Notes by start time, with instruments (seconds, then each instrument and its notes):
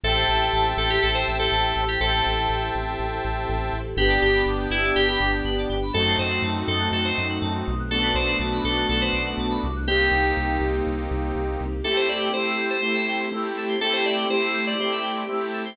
0.03 synth bass 2 A1, string ensemble 1 C4 E4 G4 A4, electric piano 2 A4, lead 2 (sawtooth) C5 E5 G5 A5
0.16 electric piano 2 C5
0.28 synth bass 2 A1, electric piano 2 E5
0.41 electric piano 2 G5
0.53 synth bass 2 A1, electric piano 2 A5
0.65 electric piano 2 C6
0.77 synth bass 2 A1, electric piano 2 A4 E6
0.89 electric piano 2 G4 G6
1.02 synth bass 2 A1, electric piano 2 A4
1.15 electric piano 2 C5
1.26 synth bass 2 A1, electric piano 2 E5
1.39 electric piano 2 A4 G5
1.52 synth bass 2 A1, electric piano 2 A5
1.63 electric piano 2 C6
1.76 synth bass 2 A1, electric piano 2 E6
1.87 electric piano 2 G4 G6
2.01 synth bass 2 A1, string ensemble 1 C4 E4 G4 A4, electric piano 2 A4, lead 2 (sawtooth) C5 E5 G5 A5
2.26 synth bass 2 A1
2.49 synth bass 2 A1
2.75 synth bass 2 A1
2.99 synth bass 2 A1
3.24 synth bass 2 A1
3.49 synth bass 2 A1
3.73 synth bass 2 A1
3.97 synth bass 2 G1, string ensemble 1 B3 D4 G4, lead 2 (sawtooth) B3 D4 G4, electric piano 2 G4 B4
4.10 electric piano 2 D5
4.21 synth bass 2 G1, electric piano 2 G4 G5
4.35 electric piano 2 B5
4.46 synth bass 2 G1, electric piano 2 D6
4.60 electric piano 2 G6
4.70 synth bass 2 G1, electric piano 2 E4 B4
4.84 electric piano 2 D5
4.96 synth bass 2 G1, electric piano 2 G4 G5
5.08 electric piano 2 G4 B5
5.20 synth bass 2 G1, electric piano 2 D6
5.33 electric piano 2 G6
5.44 synth bass 2 G1, electric piano 2 B4
5.58 electric piano 2 D5
5.69 synth bass 2 G1, electric piano 2 G5
5.82 electric piano 2 B5
5.93 synth bass 2 F#2, lead 2 (sawtooth) A3 C4 D#4 F#4, string ensemble 1 A3 C4 D#4 F#4, electric piano 2 A4
6.07 electric piano 2 C5
6.18 synth bass 2 F#2, electric piano 2 C5 D#5
6.31 electric piano 2 F#5
6.42 synth bass 2 F#2, electric piano 2 A5
6.56 electric piano 2 C6
6.68 synth bass 2 F#2, electric piano 2 A4 D#6
6.79 electric piano 2 F#6
6.91 synth bass 2 F#2, electric piano 2 A4
7.04 electric piano 2 C5
7.17 synth bass 2 F#2, electric piano 2 D#5
7.29 electric piano 2 F#5
7.41 synth bass 2 F#2, electric piano 2 A5
7.53 electric piano 2 C6
7.67 synth bass 2 B1, electric piano 2 D#6
7.79 electric piano 2 F#6
7.90 string ensemble 1 A3 B3 D4 F#4, lead 2 (sawtooth) A3 B3 D4 F#4, electric piano 2 A4
8.02 electric piano 2 B4
8.14 synth bass 2 B1, electric piano 2 C5 D5
8.28 electric piano 2 F#5
8.40 synth bass 2 B1, electric piano 2 A5
8.53 electric piano 2 B5
8.64 synth bass 2 B1, electric piano 2 A4 D6
8.77 electric piano 2 F#6
8.89 synth bass 2 B1, electric piano 2 A4
9.01 electric piano 2 B4 C5
9.13 synth bass 2 B1, electric piano 2 D5
9.26 electric piano 2 F#5
9.37 synth bass 2 B1, electric piano 2 A5
9.51 electric piano 2 B5
9.63 synth bass 2 C2, electric piano 2 D6
9.76 electric piano 2 F#6
9.87 lead 2 (sawtooth) A#3 C4 D#4 G4, string ensemble 1 A#3 C4 D#4 G4, electric piano 2 G4
10.11 synth bass 2 C2
10.37 synth bass 2 C2
10.60 synth bass 2 C2
10.86 synth bass 2 C2
11.11 synth bass 2 C2
11.35 synth bass 2 C2
11.60 synth bass 2 C2
11.84 string ensemble 1 A3 C4 E4 G4, lead 2 (sawtooth) A3 C4 E4 G4, electric piano 2 A4
11.96 electric piano 2 C5
12.09 electric piano 2 D5 E5
12.20 electric piano 2 G5
12.33 lead 2 (sawtooth) A3 C4 E4 G4, electric piano 2 C5 C6
12.46 electric piano 2 E6
12.59 electric piano 2 G6
12.70 electric piano 2 A4 C5
12.82 lead 2 (sawtooth) A3 C4 E4 G4, electric piano 2 C5
12.94 electric piano 2 E5
13.08 electric piano 2 G5
13.18 electric piano 2 C6
13.32 lead 2 (sawtooth) A3 C4 E4 G4, electric piano 2 E6
13.45 electric piano 2 G6
13.57 electric piano 2 A4
13.68 electric piano 2 C5
13.81 string ensemble 1 A3 C4 E4 G4, lead 2 (sawtooth) A3 C4 E4 G4, electric piano 2 A4
13.93 electric piano 2 C5
14.06 electric piano 2 D5 E5
14.17 electric piano 2 G5
14.30 lead 2 (sawtooth) A3 C4 E4 G4, electric piano 2 C5 C6
14.43 electric piano 2 E6
14.54 electric piano 2 G6
14.67 electric piano 2 A4 D5
14.80 lead 2 (sawtooth) A3 C4 E4 G4, electric piano 2 C5
14.92 electric piano 2 E5
15.03 electric piano 2 G5
15.16 electric piano 2 C6
15.28 lead 2 (sawtooth) A3 C4 E4 G4, electric piano 2 E6
15.42 electric piano 2 G6
15.53 electric piano 2 A4
15.65 electric piano 2 C5